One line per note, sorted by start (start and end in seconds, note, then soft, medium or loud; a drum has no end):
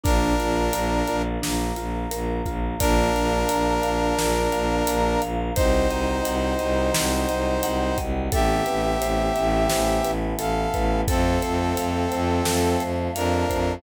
0.03 0.33 A#1 loud
0.03 1.22 D4 medium
0.03 0.35 D4 medium
0.03 1.22 A#4 loud
0.03 1.41 A#4 medium
0.03 1.41 D5 medium
0.03 1.41 F5 medium
0.03 kick loud
0.03 closed hi-hat loud
0.39 0.69 A#1 medium
0.39 0.70 F4 medium
0.39 closed hi-hat medium
0.73 1.02 A#1 loud
0.73 1.05 A#4 medium
0.73 closed hi-hat loud
1.07 1.37 A#1 medium
1.07 1.40 F4 medium
1.07 closed hi-hat medium
1.42 1.72 A#1 medium
1.42 1.73 D4 medium
1.42 2.80 A#4 medium
1.42 2.80 F5 medium
1.42 2.80 A#5 medium
1.42 snare loud
1.76 2.06 A#1 medium
1.76 2.08 F4 medium
1.76 closed hi-hat medium
2.11 2.41 A#1 medium
2.11 2.42 A#4 medium
2.11 closed hi-hat loud
2.45 2.75 A#1 medium
2.45 2.77 F4 medium
2.45 kick medium
2.45 closed hi-hat medium
2.79 3.10 A#1 loud
2.79 4.16 A#3 medium
2.79 5.21 D4 medium
2.79 4.16 D4 medium
2.79 4.16 F4 medium
2.79 5.21 A#4 loud
2.79 3.11 D5 loud
2.79 kick loud
2.79 closed hi-hat loud
3.15 3.44 A#1 medium
3.15 3.46 F5 medium
3.15 closed hi-hat medium
3.49 3.79 A#1 medium
3.49 3.80 A#5 medium
3.49 closed hi-hat loud
3.83 4.13 A#1 medium
3.83 4.15 F5 medium
3.83 closed hi-hat medium
4.18 4.47 A#1 medium
4.18 5.54 A#3 medium
4.18 5.54 F4 medium
4.18 5.54 A#4 medium
4.18 4.49 D5 medium
4.18 snare loud
4.52 4.82 A#1 medium
4.52 4.83 F5 medium
4.52 closed hi-hat medium
4.87 5.16 A#1 medium
4.87 5.19 A#5 medium
4.87 closed hi-hat loud
5.21 5.51 A#1 medium
5.21 5.53 F5 medium
5.21 closed hi-hat medium
5.55 5.85 C2 medium
5.55 6.93 C4 medium
5.55 7.98 D#4 medium
5.55 6.93 D#4 medium
5.55 6.93 F#4 medium
5.55 7.98 C5 medium
5.55 5.87 C5 loud
5.55 kick loud
5.55 closed hi-hat loud
5.90 6.19 C2 medium
5.90 6.22 D#5 medium
5.90 closed hi-hat medium
6.24 6.54 C2 medium
6.24 6.55 F#5 medium
6.24 closed hi-hat loud
6.59 6.90 C2 medium
6.59 6.91 D#5 medium
6.59 closed hi-hat medium
6.94 7.25 C2 medium
6.94 8.32 F#3 medium
6.94 8.31 C4 medium
6.94 8.32 F#4 medium
6.94 7.25 C5 medium
6.94 snare loud
7.29 7.59 C2 medium
7.29 7.60 D#5 medium
7.29 closed hi-hat medium
7.63 7.93 C2 medium
7.63 7.95 F#5 medium
7.63 closed hi-hat loud
7.98 8.28 C2 medium
7.98 8.29 D#5 medium
7.98 kick medium
7.98 closed hi-hat medium
8.31 8.61 A1 loud
8.31 9.68 A3 medium
8.31 9.68 B3 medium
8.31 9.68 C4 medium
8.31 9.68 E4 medium
8.31 10.11 G4 medium
8.31 8.63 A4 loud
8.31 10.11 E5 medium
8.31 kick loud
8.31 closed hi-hat loud
8.66 8.96 A1 medium
8.66 8.98 B4 medium
8.66 closed hi-hat medium
9.01 9.30 A1 medium
9.01 9.32 C5 medium
9.01 closed hi-hat loud
9.35 9.66 A1 loud
9.35 9.66 E5 medium
9.35 closed hi-hat medium
9.69 10.00 A1 medium
9.69 11.05 E3 medium
9.69 11.05 A3 medium
9.69 11.05 B3 medium
9.69 11.05 E4 medium
9.69 10.01 C5 medium
9.69 snare loud
10.04 10.33 A1 medium
10.04 10.36 B4 medium
10.04 closed hi-hat medium
10.37 10.67 A1 medium
10.37 10.70 A4 medium
10.37 11.01 A4 medium
10.37 11.01 F5 medium
10.37 closed hi-hat loud
10.73 11.03 A1 medium
10.73 11.05 B4 medium
10.73 kick medium
10.73 closed hi-hat medium
11.07 11.37 F2 loud
11.07 12.44 A3 medium
11.07 12.44 C4 medium
11.07 12.82 C4 medium
11.07 12.44 F4 medium
11.07 11.39 A4 medium
11.07 12.82 A4 medium
11.07 kick loud
11.07 closed hi-hat loud
11.42 11.73 F2 medium
11.42 11.74 C5 medium
11.42 closed hi-hat medium
11.77 12.06 F2 medium
11.77 12.08 F5 medium
11.77 closed hi-hat loud
12.11 12.41 F2 loud
12.11 12.42 C5 medium
12.11 closed hi-hat medium
12.45 12.76 F2 medium
12.45 13.82 F3 medium
12.45 13.82 A3 medium
12.45 13.82 F4 medium
12.45 12.77 A4 medium
12.45 snare loud
12.79 13.09 F2 medium
12.79 13.11 C5 medium
12.79 closed hi-hat medium
13.15 13.44 F2 loud
13.15 13.74 D4 medium
13.15 13.74 A#4 medium
13.15 13.46 F5 medium
13.15 closed hi-hat loud
13.49 13.78 F2 medium
13.49 13.81 C5 medium
13.49 kick medium
13.49 closed hi-hat medium